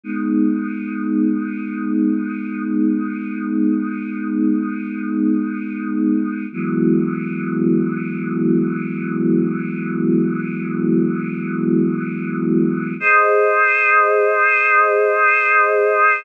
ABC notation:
X:1
M:4/4
L:1/8
Q:1/4=74
K:G#m
V:1 name="Choir Aahs"
[G,B,D]8- | [G,B,D]8 | [E,F,G,B,]8- | [E,F,G,B,]8 |
[K:Ab] [Ace]8 |]